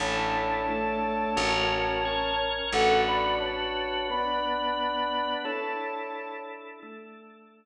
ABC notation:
X:1
M:4/4
L:1/8
Q:1/4=88
K:A
V:1 name="Ocarina"
[ca]8 | [Af] [db] [ca]2 [db]4 | [ca]3 z5 |]
V:2 name="Electric Bass (finger)" clef=bass
A,,,4 A,,,4 | A,,,8 | z8 |]
V:3 name="Drawbar Organ"
[DEA]2 [A,DA]2 [CF^A]2 [CAc]2 | [DFB]4 [B,DB]4 | [DEA]4 [A,DA]4 |]